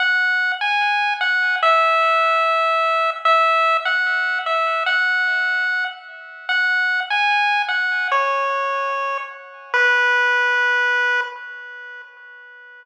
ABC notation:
X:1
M:2/4
L:1/16
Q:1/4=74
K:B
V:1 name="Lead 1 (square)"
f3 g3 f2 | e8 | e3 f3 e2 | f6 z2 |
f3 g3 f2 | c6 z2 | B8 |]